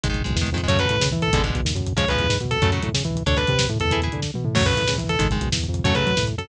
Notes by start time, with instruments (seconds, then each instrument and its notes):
0.03 synth bass 1 G#1, overdriven guitar D#3 G#3, kick, closed hi-hat
0.09 overdriven guitar D#3 G#3, kick
0.14 kick, closed hi-hat
0.21 overdriven guitar D#3 G#3, kick
0.25 synth bass 1 B1, kick, closed hi-hat
0.31 kick
0.36 synth bass 1 E2, kick, snare
0.41 overdriven guitar D#3 G#3, kick
0.47 kick, closed hi-hat
0.52 synth bass 1 F2, overdriven guitar D#3 G#3, kick
0.57 overdriven guitar D#3 G#3, kick, closed hi-hat
0.63 overdriven guitar D#3 G#3, kick
0.68 synth bass 1 F#2, overdriven guitar C#3 F#3 A3, distortion guitar C#5, kick, closed hi-hat
0.75 kick, closed hi-hat
0.79 overdriven guitar C#3 F#3 A3, distortion guitar B4, kick
0.85 kick, closed hi-hat
0.90 synth bass 1 A2, kick
0.95 kick
1.00 synth bass 1 C#3, kick, snare
1.06 kick
1.11 synth bass 1 E3, kick, closed hi-hat
1.17 kick
1.22 distortion guitar A4, kick, closed hi-hat
1.28 kick
1.33 synth bass 1 G#1, overdriven guitar B2 D3 G#3, kick, closed hi-hat
1.38 kick
1.44 overdriven guitar B2 D3 G#3, kick, closed hi-hat
1.50 kick
1.55 synth bass 1 B1, kick, closed hi-hat
1.60 kick
1.65 synth bass 1 D#2, kick, snare
1.70 kick
1.75 synth bass 1 F#2, kick, closed hi-hat
1.81 kick
1.86 kick, closed hi-hat
1.93 overdriven guitar C#3 F3 G#3, kick
1.97 synth bass 1 C#2, distortion guitar C#5, kick, closed hi-hat
2.03 kick
2.08 overdriven guitar C#3 F3 G#3, distortion guitar B4, kick, closed hi-hat
2.15 kick, closed hi-hat
2.19 synth bass 1 E2, kick
2.24 kick
2.29 synth bass 1 G#2, kick, snare
2.35 kick
2.40 synth bass 1 B2, kick, closed hi-hat
2.45 kick
2.51 distortion guitar A4, kick, closed hi-hat
2.57 kick
2.62 synth bass 1 F#2, overdriven guitar C#3 F#3 A3, kick, closed hi-hat
2.68 kick
2.72 overdriven guitar C#3 F#3 A3, kick, closed hi-hat
2.78 kick
2.82 synth bass 1 A2, kick, closed hi-hat
2.89 kick
2.94 synth bass 1 C#3, kick, snare
3.00 kick
3.05 synth bass 1 E3, kick, closed hi-hat
3.11 kick
3.16 kick, closed hi-hat
3.21 kick
3.26 synth bass 1 D2, overdriven guitar D4 A4, distortion guitar C#5, kick, closed hi-hat
3.32 kick
3.37 overdriven guitar D4 A4, distortion guitar B4, kick, closed hi-hat
3.42 kick
3.47 synth bass 1 C3, kick, closed hi-hat
3.53 kick
3.59 kick, snare
3.65 kick
3.69 synth bass 1 A2, kick, closed hi-hat
3.76 kick
3.80 synth bass 1 E2, distortion guitar A4, kick, closed hi-hat
3.85 kick
3.91 overdriven guitar E4 G#4 B4, kick, closed hi-hat
3.97 kick
4.02 overdriven guitar E4 G#4 B4, kick, closed hi-hat
4.07 kick
4.12 synth bass 1 D3, kick, closed hi-hat
4.17 kick
4.22 kick, snare
4.34 synth bass 1 B2, high tom
4.45 synth bass 1 A2, mid tom
4.55 synth bass 1 F#2, overdriven guitar C#3 F#3 A3, distortion guitar C#5, kick, crash
4.61 kick
4.65 overdriven guitar C#3 F#3 A3, distortion guitar B4, kick, closed hi-hat
4.71 kick
4.77 synth bass 1 A2, kick, closed hi-hat
4.83 kick
4.88 synth bass 1 C#3, kick, snare
4.94 kick
4.98 synth bass 1 E3, kick, closed hi-hat
5.04 kick
5.09 distortion guitar A4, kick, closed hi-hat
5.15 kick
5.19 synth bass 1 G#1, overdriven guitar D#3 G#3, kick, closed hi-hat
5.25 kick
5.30 overdriven guitar D#3 G#3, kick, closed hi-hat
5.36 kick
5.41 synth bass 1 B1, kick, closed hi-hat
5.47 kick
5.52 synth bass 1 E2, kick, snare
5.57 kick
5.64 kick, closed hi-hat
5.68 synth bass 1 F2, kick
5.74 kick, closed hi-hat
5.79 kick
5.84 synth bass 1 F#2, overdriven guitar C#3 F#3 A3, distortion guitar C#5, kick, closed hi-hat
5.90 kick
5.94 overdriven guitar C#3 F#3 A3, synth bass 1 C#3, distortion guitar B4, kick, closed hi-hat
6.01 kick
6.06 synth bass 1 F#3, kick, closed hi-hat
6.11 kick
6.17 synth bass 1 A2, kick, snare
6.23 kick
6.27 kick, closed hi-hat
6.33 kick
6.38 synth bass 1 F#2, distortion guitar A4, kick, closed hi-hat
6.44 kick